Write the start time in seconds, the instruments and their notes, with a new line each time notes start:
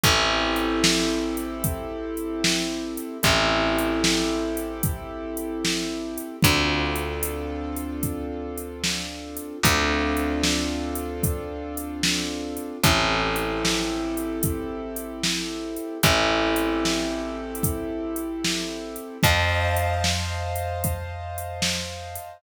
0.04 electric bass (finger) A1, acoustic grand piano C4 E4 G4 A4, kick, closed hi-hat
0.56 closed hi-hat
0.84 snare
1.37 closed hi-hat
1.64 kick, closed hi-hat
2.17 closed hi-hat
2.44 snare
2.97 closed hi-hat
3.23 electric bass (finger) A1, acoustic grand piano C4 E4 G4 A4, kick, closed hi-hat
3.79 closed hi-hat
4.04 snare
4.57 closed hi-hat
4.83 kick, closed hi-hat
5.37 closed hi-hat
5.65 snare
6.18 closed hi-hat
6.43 electric bass (finger) D2, acoustic grand piano C4 D4 F4 A4, kick, closed hi-hat
6.96 closed hi-hat
7.23 closed hi-hat
7.77 closed hi-hat
8.03 kick, closed hi-hat
8.58 closed hi-hat
8.84 snare
9.37 closed hi-hat
9.63 electric bass (finger) D2, acoustic grand piano C4 D4 F4 A4, kick, closed hi-hat
10.17 closed hi-hat
10.44 snare
10.95 closed hi-hat
11.23 kick, closed hi-hat
11.77 closed hi-hat
12.03 snare
12.57 closed hi-hat
12.84 electric bass (finger) A1, acoustic grand piano C4 E4 G4 A4, kick, closed hi-hat
13.36 closed hi-hat
13.65 snare
14.17 closed hi-hat
14.43 kick, closed hi-hat
14.96 closed hi-hat
15.24 snare
15.77 closed hi-hat
16.03 electric bass (finger) A1, acoustic grand piano C4 E4 G4 A4, kick, closed hi-hat
16.56 closed hi-hat
16.85 snare
17.55 closed hi-hat
17.63 kick, closed hi-hat
18.16 closed hi-hat
18.45 snare
18.96 closed hi-hat
19.23 electric bass (finger) F2, acoustic grand piano C5 D#5 F5 A5, kick, closed hi-hat
19.77 closed hi-hat
20.04 snare
20.56 closed hi-hat
20.84 kick, closed hi-hat
21.38 closed hi-hat
21.62 snare
22.15 closed hi-hat